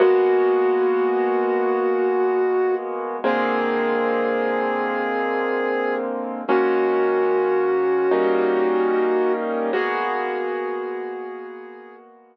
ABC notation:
X:1
M:4/4
L:1/8
Q:1/4=74
K:G#m
V:1 name="Flute"
F8 | G8 | F8 | G6 z2 |]
V:2 name="Acoustic Grand Piano"
[G,A,B,F]8 | [=D,G,A,^B,]8 | [D,G,A,C]4 [=G,A,CD]4 | [G,A,B,F]8 |]